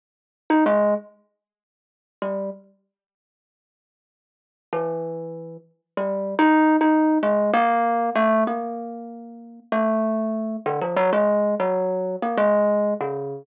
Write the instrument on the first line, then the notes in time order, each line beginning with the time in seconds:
kalimba
0.50 D#4
0.66 G#3
2.22 G3
4.73 E3
5.97 G3
6.39 D#4
6.81 D#4
7.23 G#3
7.54 A#3
8.15 A3
8.47 A#3
9.72 A3
10.66 D3
10.81 F3
10.96 F#3
11.13 G#3
11.60 F#3
12.22 A#3
12.38 G#3
13.01 C#3